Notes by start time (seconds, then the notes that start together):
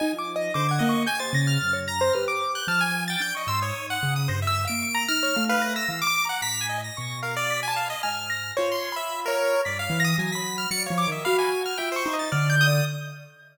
0.00 D#4 D#5 G#5
0.13 F3
0.19 D6
0.36 D#5
0.54 D3 C5 D6
0.69 F#5 G#6
0.79 A#3 D#5
0.89 C#6
1.06 G4 G#5 G6
1.19 C5 A6
1.33 C#3 A#6
1.47 F6
1.62 F#2
1.73 C#5
1.88 A#5 A#6
2.01 C5
2.13 G4 B4 F6
2.28 D6
2.55 F#6 G6
2.68 F3 A5 F6
2.81 G#5 G#6
3.08 G5 A6
3.20 D4 G6 D7
3.35 D#5 C#6
3.47 G#2 C6 E6
3.62 C#5 D#6
3.74 D#4
3.90 F#5
4.03 C#3
4.16 D#6
4.28 G2 C5 A#6
4.42 E5
4.47 E6
4.65 F5 D7
4.70 A#3
4.82 C#6
4.95 A#5
5.08 D#4 F6 A#6
5.23 C#5
5.36 A3 F5
5.49 B4 F5
5.62 A#6
5.76 E6 A#6
5.89 E3 F5
6.02 D6
6.07 D6
6.25 A#5
6.29 F#5
6.42 A2 A#5 B6
6.61 G#5
6.69 D#5
6.78 D#5
6.84 A#6
6.97 B2 C#6
7.23 A#4 F5
7.36 D5
7.50 B6
7.63 G#5
7.68 A5
7.76 F5
7.85 B5
7.90 D#5
8.03 G#2 G#5 F6
8.30 A#6
8.57 F4 C5 C#5
8.72 C6
8.92 B5
8.96 E5
9.26 A#4 C#5
9.65 G2 D5 B6
9.79 F5
9.90 E3
10.00 A#6
10.04 D#6
10.18 F#3 G#5
10.32 B5 B6
10.58 F6
10.71 F#3 D5 C#7
10.86 C#5 F5
10.90 F3
10.98 D6
11.07 D#3 D#5
11.12 E5
11.25 F#4 F5 B5
11.39 G#5
11.66 F6
11.78 F4 E5 G5
11.92 C5
11.96 C#6
12.06 D#4
12.13 D#5
12.19 A6
12.32 D3 D5 F6
12.50 G6
12.61 D#6
12.67 D5